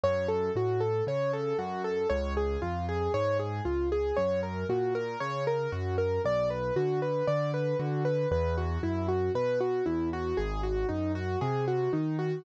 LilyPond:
<<
  \new Staff \with { instrumentName = "Acoustic Grand Piano" } { \time 4/4 \key fis \minor \tempo 4 = 58 cis''16 a'16 fis'16 a'16 cis''16 a'16 fis'16 a'16 cis''16 gis'16 eis'16 gis'16 cis''16 gis'16 eis'16 gis'16 | cis''16 ais'16 fis'16 ais'16 cis''16 ais'16 fis'16 ais'16 d''16 b'16 fis'16 b'16 d''16 b'16 fis'16 b'16 | b'16 fis'16 e'16 fis'16 b'16 fis'16 e'16 fis'16 gis'16 fis'16 dis'16 fis'16 gis'16 fis'16 dis'16 fis'16 | }
  \new Staff \with { instrumentName = "Acoustic Grand Piano" } { \clef bass \time 4/4 \key fis \minor fis,8 a,8 cis8 fis,8 cis,8 eis,8 gis,8 cis,8 | fis,8 ais,8 cis8 fis,8 b,,8 d8 d8 d8 | e,8 fis,8 b,8 e,8 gis,,8 fis,8 bis,8 dis8 | }
>>